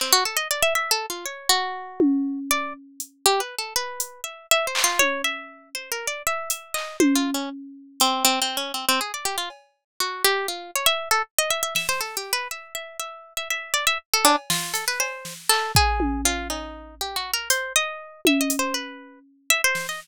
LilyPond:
<<
  \new Staff \with { instrumentName = "Orchestral Harp" } { \time 5/8 \tempo 4 = 120 c'16 fis'16 a'16 dis''16 d''16 e''16 \tuplet 3/2 { e''8 a'8 f'8 } | cis''8 fis'2 | d''8 r4 \tuplet 3/2 { g'8 b'8 a'8 } | b'4 e''8 \tuplet 3/2 { e''8 c''8 f'8 } |
cis''8 e''4 \tuplet 3/2 { c''8 ais'8 d''8 } | e''8 e''8 dis''8 \tuplet 3/2 { c''8 f'8 cis'8 } | r4 c'8 \tuplet 3/2 { c'8 c'8 cis'8 } | c'16 c'16 gis'16 d''16 g'16 f'16 r4 |
fis'8 g'8 f'8 cis''16 e''8 a'16 | r16 dis''16 e''16 e''16 e''16 c''16 \tuplet 3/2 { a'8 g'8 b'8 } | e''8 e''8 e''8. e''16 e''8 | d''16 e''16 r16 a'16 d'16 r16 f'8 a'16 b'16 |
c''8. r16 a'8 gis'4 | f'8 dis'4 \tuplet 3/2 { g'8 fis'8 ais'8 } | c''8 dis''4 \tuplet 3/2 { e''8 dis''8 c''8 } | b'4 r8 e''16 c''8 dis''16 | }
  \new DrumStaff \with { instrumentName = "Drums" } \drummode { \time 5/8 hc4. r4 | r4. tommh4 | r4 hh8 r4 | r8 hh4 r8 hc8 |
tommh4. r4 | r8 hh8 hc8 tommh4 | r4 hh8 r4 | r4. cb4 |
r4. r4 | r4 sn8 r4 | r4. r4 | r4 cb8 sn8 hh8 |
cb8 sn8 hc8 bd8 tommh8 | cb8 cb4 r4 | hh4. tommh8 hh8 | r4. r8 sn8 | }
>>